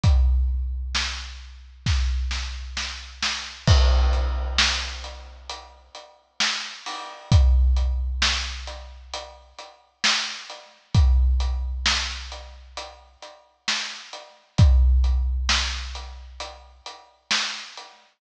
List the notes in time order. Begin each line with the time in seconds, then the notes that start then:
0.03 kick, closed hi-hat
0.95 snare
1.86 kick, snare
2.31 snare
2.77 snare
3.23 snare
3.67 kick, crash
4.13 closed hi-hat
4.58 snare
5.04 closed hi-hat
5.49 closed hi-hat
5.95 closed hi-hat
6.40 snare
6.86 open hi-hat
7.32 kick, closed hi-hat
7.77 closed hi-hat
8.22 snare
8.67 closed hi-hat
9.13 closed hi-hat
9.59 closed hi-hat
10.04 snare
10.50 closed hi-hat
10.95 kick, closed hi-hat
11.40 closed hi-hat
11.86 snare
12.32 closed hi-hat
12.77 closed hi-hat
13.22 closed hi-hat
13.68 snare
14.13 closed hi-hat
14.58 kick, closed hi-hat
15.04 closed hi-hat
15.49 snare
15.95 closed hi-hat
16.40 closed hi-hat
16.86 closed hi-hat
17.31 snare
17.77 closed hi-hat